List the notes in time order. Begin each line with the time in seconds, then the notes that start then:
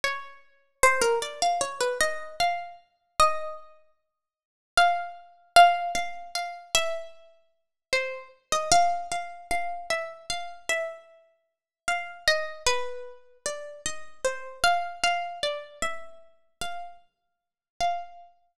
0.04 C#5
0.83 C5
1.01 A#4
1.22 D5
1.42 F5
1.61 C#5
1.80 B4
2.00 D#5
2.40 F5
3.20 D#5
4.77 F5
5.56 F5
5.95 F5
6.35 F5
6.75 E5
7.93 C5
8.52 D#5
8.72 F5
9.12 F5
9.51 F5
9.90 E5
10.30 F5
10.69 E5
11.88 F5
12.27 D#5
12.66 B4
13.46 D5
13.86 D#5
14.25 C5
14.64 F5
15.03 F5
15.43 D5
15.82 E5
16.61 F5
17.80 F5